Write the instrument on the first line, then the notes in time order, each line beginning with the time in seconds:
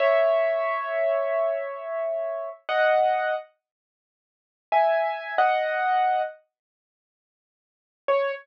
acoustic grand piano
0.00 C#5 E5
2.69 D#5 F#5
4.72 E5 G#5
5.38 D#5 F#5
8.08 C#5